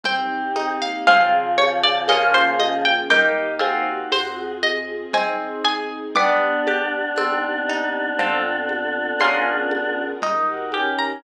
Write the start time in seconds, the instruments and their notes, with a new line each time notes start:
0.03 synth bass 2 C2, choir aahs C4, harpsichord C4, string ensemble 1 C4 D#4 G4, xylophone C5, pizzicato strings G5, low conga
0.56 harpsichord D#4, xylophone D#5, high conga
0.80 choir aahs A#3, pizzicato strings F5
1.07 synth bass 2 G#1, choir aahs C#3 F3, harpsichord C4 F4 G#4, string ensemble 1 C4 F4 G#4, xylophone C5 F5 G#5, pizzicato strings F5, low conga
1.58 pizzicato strings C#5, high conga
1.83 pizzicato strings D5
2.08 synth bass 2 A#1, string ensemble 1 A#3 C#4 F4 G#4, harpsichord A#3 C#4 F4, xylophone A#4 C#5 F5 G#5, pizzicato strings D#5, tambourine, high conga
2.12 harpsichord G#4
2.34 pizzicato strings C5
2.59 pizzicato strings D#5, high conga
2.85 pizzicato strings G5
3.10 synth bass 2 D#2, harpsichord A#3 D#4 G4, string ensemble 1 A#3 D#4 G4, choir aahs D#4, xylophone A#4 D#5 G5, pizzicato strings G5, low conga
3.59 harpsichord C4 F4 G#4, choir aahs F#4, xylophone C5 F5 G#5, high conga
4.12 synth bass 2 F2, string ensemble 1 C4 F4 G#4, pizzicato strings C5, tambourine, high conga
4.63 pizzicato strings D#5, high conga
5.13 synth bass 2 G#1, harpsichord C4, string ensemble 1 C4 D#4 G#4, xylophone C5 D#5 G#5, pizzicato strings G#5, low conga
5.64 synth bass 2 G1, harpsichord G#4, pizzicato strings G#5
6.15 string ensemble 1 B3 D4 G4, choir aahs B3 D4, harpsichord B3, xylophone B4 D5 G5, pizzicato strings D6, low conga
6.67 harpsichord G4, high conga
7.16 synth bass 2 C2, string ensemble 1 C4 D#4 G4, harpsichord C4, xylophone C5, tambourine, high conga
7.68 harpsichord D#4, xylophone D#5
8.19 synth bass 2 F2, string ensemble 1 C4 F4 A4, harpsichord C4 F4 A4, xylophone C5 F5 A5, low conga
8.69 high conga
9.19 synth bass 2 C#2, string ensemble 1 C#4 F4 G#4 A#4, harpsichord C#4 F4 G#4, xylophone C#5 F5 G#5 A#5, pizzicato strings C6, tambourine, high conga
9.24 harpsichord A#4
9.71 high conga
10.22 synth bass 2 D#2, string ensemble 1 D#4 G4 A#4, harpsichord D#4, xylophone D#5, low conga
10.49 choir aahs F#4
10.72 choir aahs C#4, harpsichord G4, xylophone G5, high conga
10.99 pizzicato strings A#5